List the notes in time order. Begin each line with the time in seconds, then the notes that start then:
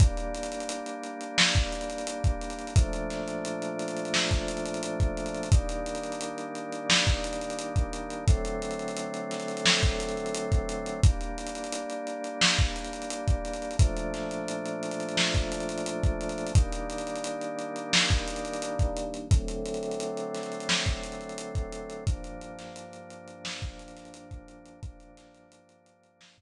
0.00 G3 A#3 D4, kick, closed hi-hat
0.17 closed hi-hat
0.34 closed hi-hat
0.43 closed hi-hat
0.52 closed hi-hat
0.60 closed hi-hat
0.69 closed hi-hat
0.86 closed hi-hat
1.03 closed hi-hat
1.21 closed hi-hat
1.38 snare
1.55 kick, closed hi-hat
1.72 closed hi-hat
1.81 closed hi-hat
1.90 closed hi-hat
1.98 closed hi-hat
2.07 closed hi-hat
2.24 kick, closed hi-hat
2.41 closed hi-hat
2.50 closed hi-hat
2.59 closed hi-hat
2.67 closed hi-hat
2.76 A#2 F3 A3 D4, kick, closed hi-hat
2.93 closed hi-hat
3.10 snare, closed hi-hat
3.28 closed hi-hat
3.45 closed hi-hat
3.62 closed hi-hat
3.79 closed hi-hat
3.88 closed hi-hat
3.97 closed hi-hat
4.05 closed hi-hat
4.14 snare
4.31 kick, closed hi-hat
4.48 closed hi-hat
4.57 closed hi-hat
4.66 closed hi-hat
4.74 closed hi-hat
4.83 closed hi-hat
5.00 kick, closed hi-hat
5.17 closed hi-hat
5.26 closed hi-hat
5.34 closed hi-hat
5.43 closed hi-hat
5.52 D#3 G3 A#3 D4, kick, closed hi-hat
5.69 closed hi-hat
5.86 closed hi-hat
5.95 closed hi-hat
6.03 closed hi-hat
6.12 closed hi-hat
6.21 closed hi-hat
6.38 closed hi-hat
6.55 closed hi-hat
6.72 closed hi-hat
6.90 snare
7.07 kick, snare, closed hi-hat
7.24 closed hi-hat
7.33 closed hi-hat
7.41 closed hi-hat
7.50 closed hi-hat
7.59 closed hi-hat
7.76 kick, closed hi-hat
7.93 closed hi-hat
8.10 closed hi-hat
8.28 D3 F#3 A3 C4, kick, closed hi-hat
8.45 closed hi-hat
8.62 closed hi-hat
8.71 closed hi-hat
8.79 closed hi-hat
8.88 closed hi-hat
8.97 closed hi-hat
9.14 closed hi-hat
9.31 snare, closed hi-hat
9.40 closed hi-hat
9.48 closed hi-hat
9.57 closed hi-hat
9.66 snare
9.83 kick, closed hi-hat
10.00 closed hi-hat
10.09 closed hi-hat
10.17 closed hi-hat
10.26 closed hi-hat
10.34 closed hi-hat
10.52 kick, closed hi-hat
10.69 closed hi-hat
10.86 closed hi-hat
11.03 G3 A#3 D4, kick, closed hi-hat
11.21 closed hi-hat
11.38 closed hi-hat
11.47 closed hi-hat
11.55 closed hi-hat
11.64 closed hi-hat
11.72 closed hi-hat
11.90 closed hi-hat
12.07 closed hi-hat
12.24 closed hi-hat
12.41 snare
12.59 kick, closed hi-hat
12.76 closed hi-hat
12.84 closed hi-hat
12.93 closed hi-hat
13.02 closed hi-hat
13.10 closed hi-hat
13.28 kick, closed hi-hat
13.45 closed hi-hat
13.53 closed hi-hat
13.62 closed hi-hat
13.71 closed hi-hat
13.79 A#2 F3 A3 D4, kick, closed hi-hat
13.97 closed hi-hat
14.14 snare, closed hi-hat
14.31 closed hi-hat
14.48 closed hi-hat
14.66 closed hi-hat
14.83 closed hi-hat
14.91 closed hi-hat
15.00 closed hi-hat
15.09 closed hi-hat
15.17 snare
15.34 kick, closed hi-hat
15.52 closed hi-hat
15.60 closed hi-hat
15.69 closed hi-hat
15.78 closed hi-hat
15.86 closed hi-hat
16.03 kick, closed hi-hat
16.21 closed hi-hat
16.29 closed hi-hat
16.38 closed hi-hat
16.47 closed hi-hat
16.55 D#3 G3 A#3 D4, kick, closed hi-hat
16.72 closed hi-hat
16.90 closed hi-hat
16.98 closed hi-hat
17.07 closed hi-hat
17.16 closed hi-hat
17.24 closed hi-hat
17.41 closed hi-hat
17.59 closed hi-hat
17.76 closed hi-hat
17.93 snare
18.10 kick, snare, closed hi-hat
18.28 closed hi-hat
18.36 closed hi-hat
18.45 closed hi-hat
18.53 closed hi-hat
18.62 closed hi-hat
18.79 kick, closed hi-hat
18.97 closed hi-hat
19.14 closed hi-hat
19.31 D3 F#3 A3 C4, kick, closed hi-hat
19.48 closed hi-hat
19.66 closed hi-hat
19.74 closed hi-hat
19.83 closed hi-hat
19.91 closed hi-hat
20.00 closed hi-hat
20.17 closed hi-hat
20.34 snare, closed hi-hat
20.43 closed hi-hat
20.52 closed hi-hat
20.60 closed hi-hat
20.69 snare
20.86 kick, closed hi-hat
21.03 closed hi-hat
21.12 closed hi-hat
21.21 closed hi-hat
21.29 closed hi-hat
21.38 closed hi-hat
21.55 kick, closed hi-hat
21.72 closed hi-hat
21.90 closed hi-hat
22.07 G2 F3 A#3 D4, kick, closed hi-hat
22.24 closed hi-hat
22.41 closed hi-hat
22.59 snare, closed hi-hat
22.76 closed hi-hat
22.93 closed hi-hat
23.10 closed hi-hat
23.28 closed hi-hat
23.45 snare
23.62 kick, closed hi-hat
23.79 closed hi-hat
23.88 closed hi-hat
23.97 snare, closed hi-hat
24.05 closed hi-hat
24.14 closed hi-hat
24.31 kick, closed hi-hat
24.48 closed hi-hat
24.66 closed hi-hat
24.83 G2 F3 A#3 D4, kick, closed hi-hat
25.00 closed hi-hat
25.17 snare, closed hi-hat
25.34 closed hi-hat
25.52 closed hi-hat
25.69 closed hi-hat
25.86 closed hi-hat
26.03 closed hi-hat
26.21 snare
26.38 kick, closed hi-hat